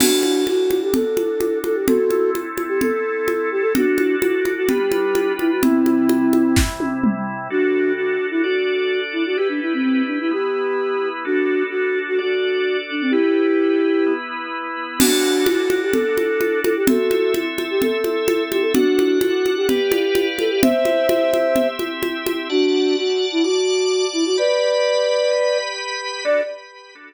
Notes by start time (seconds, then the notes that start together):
0.00 D4 F#4 A4, crash, low conga
0.23 high conga
0.46 F#4, high conga
0.71 high conga
0.82 G4
0.94 A4, low conga
1.17 high conga
1.41 high conga
1.64 A4, high conga
1.75 G4
1.87 C4 E4 F#4 A4, low conga
2.10 high conga
2.35 high conga
2.58 high conga
2.68 G4
2.81 A4, low conga
3.28 high conga
3.51 G4
3.62 A4
3.75 D4 F#4 A4, low conga
3.98 high conga
4.21 F#4, high conga
4.45 high conga
4.57 F#4
4.69 G3 D4 F4 G4 B4, low conga
4.92 high conga
5.15 high conga
5.39 E4, high conga
5.51 F#4
5.62 C3 G3 C4 E4, low conga
5.86 high conga
6.09 high conga
6.33 high conga
6.56 kick, snare
6.80 high tom
7.04 mid tom
7.50 D4 F#4 A4
7.97 F#4
8.31 E4
8.43 D4 F#4 A4 D5
9.13 E4
9.26 F#4
9.37 E4 G4 B4
9.49 D4
9.62 E4
9.74 C4
9.83 C4
10.07 D4
10.20 E4
10.31 B3 E4 G4 B4
11.25 D4 F#4 A4
11.70 F#4
12.08 F#4
12.18 D4 F#4 A4 D5
12.91 D4
13.01 C4
13.11 E4 G4 B4
14.06 B3 E4 B4
14.99 D4 F#4 A4, crash, low conga
15.46 F#4, high conga
15.70 high conga
15.82 G4
15.92 A4, low conga
16.17 high conga
16.41 high conga
16.63 A4, high conga
16.76 G4
16.87 C4 F#4 A4 E5, low conga
17.11 high conga
17.34 high conga
17.58 high conga
17.71 G4
17.82 A4, low conga
18.04 high conga
18.28 high conga
18.51 G4, high conga
18.62 A4
18.73 D4 F#4 A4 F#5, low conga
18.99 high conga
19.21 F#4, high conga
19.46 high conga
19.57 G4
19.68 G4 B4 D5 F5, low conga
19.92 high conga
20.15 high conga
20.39 A4, high conga
20.50 G4
20.62 C4 G4 C5 E5, low conga
20.85 high conga
21.09 high conga
21.33 high conga
21.56 low conga
21.79 high conga
22.03 high conga
22.26 high conga
22.50 D4 F#4 D5 F#5 A5
22.97 F#4
23.32 E4
23.43 F#4 D5 A5 D6
24.13 E4
24.26 F#4
24.38 G4 B4 D5 B5
25.31 G4 B4 B5
26.25 D4 F#4 A4 D5